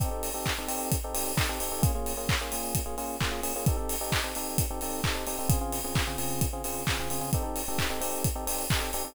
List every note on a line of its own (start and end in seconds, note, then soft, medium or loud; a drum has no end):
0.00 0.09 C4 loud
0.00 0.09 D#4 loud
0.00 0.09 G4 loud
0.00 0.09 A4 loud
0.00 kick medium
0.00 closed hi-hat medium
0.11 0.29 C4 medium
0.11 0.29 D#4 medium
0.11 0.29 G4 medium
0.11 0.29 A4 medium
0.23 open hi-hat medium
0.34 0.53 C4 medium
0.34 0.53 D#4 medium
0.34 0.53 G4 medium
0.34 0.53 A4 medium
0.46 kick medium
0.46 clap loud
0.58 0.68 C4 medium
0.58 0.68 D#4 medium
0.58 0.68 G4 medium
0.58 0.68 A4 medium
0.68 0.96 C4 loud
0.68 0.96 D#4 medium
0.68 0.96 G4 loud
0.68 0.96 A4 medium
0.68 open hi-hat medium
0.92 kick medium
0.92 closed hi-hat loud
1.04 1.13 C4 medium
1.04 1.13 D#4 loud
1.04 1.13 G4 loud
1.04 1.13 A4 medium
1.14 1.32 C4 medium
1.14 1.32 D#4 medium
1.14 1.32 G4 loud
1.14 1.32 A4 medium
1.14 open hi-hat medium
1.37 1.46 C4 medium
1.37 1.46 D#4 medium
1.37 1.46 G4 loud
1.37 1.46 A4 medium
1.37 kick medium
1.37 clap loud
1.49 1.58 C4 medium
1.49 1.58 D#4 medium
1.49 1.58 G4 medium
1.49 1.58 A4 medium
1.60 1.69 C4 loud
1.60 1.69 D#4 medium
1.60 1.69 G4 loud
1.60 1.69 A4 medium
1.60 open hi-hat medium
1.72 1.81 C4 medium
1.72 1.81 D#4 medium
1.72 1.81 G4 loud
1.72 1.81 A4 loud
1.82 1.92 A#3 loud
1.82 1.92 C#4 loud
1.82 1.92 F4 loud
1.82 1.92 G#4 loud
1.82 kick loud
1.82 closed hi-hat loud
1.95 2.13 A#3 medium
1.95 2.13 C#4 medium
1.95 2.13 F4 medium
1.95 2.13 G#4 medium
2.06 open hi-hat medium
2.17 2.35 A#3 medium
2.17 2.35 C#4 medium
2.17 2.35 F4 medium
2.17 2.35 G#4 medium
2.29 kick medium
2.29 clap loud
2.41 2.50 A#3 loud
2.41 2.50 C#4 medium
2.41 2.50 F4 medium
2.41 2.50 G#4 medium
2.52 2.80 A#3 medium
2.52 2.80 C#4 medium
2.52 2.80 F4 medium
2.52 2.80 G#4 loud
2.52 open hi-hat medium
2.75 kick medium
2.75 closed hi-hat loud
2.86 2.95 A#3 medium
2.86 2.95 C#4 medium
2.86 2.95 F4 medium
2.86 2.95 G#4 loud
2.98 3.16 A#3 medium
2.98 3.16 C#4 loud
2.98 3.16 F4 loud
2.98 3.16 G#4 medium
2.98 open hi-hat medium
3.21 3.30 A#3 loud
3.21 3.30 C#4 medium
3.21 3.30 F4 medium
3.21 3.30 G#4 loud
3.21 kick medium
3.21 clap loud
3.31 3.40 A#3 medium
3.31 3.40 C#4 medium
3.31 3.40 F4 loud
3.31 3.40 G#4 loud
3.43 3.52 A#3 medium
3.43 3.52 C#4 medium
3.43 3.52 F4 medium
3.43 3.52 G#4 loud
3.43 open hi-hat medium
3.56 3.65 A#3 medium
3.56 3.65 C#4 medium
3.56 3.65 F4 medium
3.56 3.65 G#4 medium
3.66 3.76 C4 medium
3.66 3.76 D#4 loud
3.66 3.76 G4 medium
3.66 3.76 A4 loud
3.66 kick loud
3.66 closed hi-hat medium
3.77 3.95 C4 medium
3.77 3.95 D#4 medium
3.77 3.95 G4 medium
3.77 3.95 A4 loud
3.89 open hi-hat medium
4.01 4.19 C4 medium
4.01 4.19 D#4 loud
4.01 4.19 G4 medium
4.01 4.19 A4 medium
4.12 kick medium
4.12 clap loud
4.24 4.33 C4 medium
4.24 4.33 D#4 medium
4.24 4.33 G4 medium
4.24 4.33 A4 medium
4.35 4.64 C4 medium
4.35 4.64 D#4 medium
4.35 4.64 G4 medium
4.35 4.64 A4 medium
4.35 open hi-hat medium
4.58 kick medium
4.58 closed hi-hat loud
4.71 4.80 C4 loud
4.71 4.80 D#4 medium
4.71 4.80 G4 medium
4.71 4.80 A4 medium
4.81 5.01 C4 loud
4.81 5.01 D#4 loud
4.81 5.01 G4 medium
4.81 5.01 A4 loud
4.81 open hi-hat medium
5.04 5.14 C4 medium
5.04 5.14 D#4 medium
5.04 5.14 G4 medium
5.04 5.14 A4 medium
5.04 kick medium
5.04 clap loud
5.15 5.24 C4 medium
5.15 5.24 D#4 medium
5.15 5.24 G4 medium
5.15 5.24 A4 medium
5.27 5.36 C4 medium
5.27 5.36 D#4 medium
5.27 5.36 G4 loud
5.27 5.36 A4 medium
5.27 open hi-hat medium
5.39 5.48 C4 loud
5.39 5.48 D#4 medium
5.39 5.48 G4 medium
5.39 5.48 A4 medium
5.49 5.58 C#3 loud
5.49 5.58 C4 loud
5.49 5.58 F4 loud
5.49 5.58 G#4 loud
5.49 kick loud
5.49 closed hi-hat loud
5.61 5.79 C#3 medium
5.61 5.79 C4 medium
5.61 5.79 F4 loud
5.61 5.79 G#4 medium
5.72 open hi-hat medium
5.84 6.03 C#3 medium
5.84 6.03 C4 medium
5.84 6.03 F4 medium
5.84 6.03 G#4 medium
5.95 kick medium
5.95 clap loud
6.07 6.16 C#3 medium
6.07 6.16 C4 medium
6.07 6.16 F4 medium
6.07 6.16 G#4 loud
6.18 6.46 C#3 loud
6.18 6.46 C4 medium
6.18 6.46 F4 medium
6.18 6.46 G#4 loud
6.18 open hi-hat medium
6.41 kick medium
6.41 closed hi-hat loud
6.53 6.62 C#3 medium
6.53 6.62 C4 medium
6.53 6.62 F4 medium
6.53 6.62 G#4 medium
6.64 6.83 C#3 medium
6.64 6.83 C4 medium
6.64 6.83 F4 medium
6.64 6.83 G#4 medium
6.64 open hi-hat medium
6.87 6.98 C#3 medium
6.87 6.98 C4 medium
6.87 6.98 F4 medium
6.87 6.98 G#4 medium
6.87 kick medium
6.87 clap loud
6.99 7.08 C#3 medium
6.99 7.08 C4 medium
6.99 7.08 F4 medium
6.99 7.08 G#4 loud
7.10 7.20 C#3 medium
7.10 7.20 C4 medium
7.10 7.20 F4 medium
7.10 7.20 G#4 loud
7.10 open hi-hat medium
7.21 7.30 C#3 medium
7.21 7.30 C4 medium
7.21 7.30 F4 medium
7.21 7.30 G#4 loud
7.33 7.43 C4 loud
7.33 7.43 D#4 loud
7.33 7.43 G4 loud
7.33 7.43 A4 loud
7.33 kick medium
7.33 closed hi-hat medium
7.43 7.62 C4 medium
7.43 7.62 D#4 medium
7.43 7.62 G4 medium
7.43 7.62 A4 medium
7.56 open hi-hat medium
7.68 7.86 C4 medium
7.68 7.86 D#4 medium
7.68 7.86 G4 medium
7.68 7.86 A4 medium
7.79 kick medium
7.79 clap loud
7.90 7.99 C4 medium
7.90 7.99 D#4 medium
7.90 7.99 G4 medium
7.90 7.99 A4 medium
8.01 8.28 C4 loud
8.01 8.28 D#4 medium
8.01 8.28 G4 loud
8.01 8.28 A4 medium
8.01 open hi-hat medium
8.24 kick medium
8.24 closed hi-hat loud
8.35 8.45 C4 medium
8.35 8.45 D#4 loud
8.35 8.45 G4 loud
8.35 8.45 A4 medium
8.47 8.65 C4 medium
8.47 8.65 D#4 medium
8.47 8.65 G4 loud
8.47 8.65 A4 medium
8.47 open hi-hat medium
8.70 8.80 C4 medium
8.70 8.80 D#4 medium
8.70 8.80 G4 loud
8.70 8.80 A4 medium
8.70 kick medium
8.70 clap loud
8.81 8.90 C4 medium
8.81 8.90 D#4 medium
8.81 8.90 G4 medium
8.81 8.90 A4 medium
8.93 9.03 C4 loud
8.93 9.03 D#4 medium
8.93 9.03 G4 loud
8.93 9.03 A4 medium
8.93 open hi-hat medium
9.05 9.14 C4 medium
9.05 9.14 D#4 medium
9.05 9.14 G4 loud
9.05 9.14 A4 loud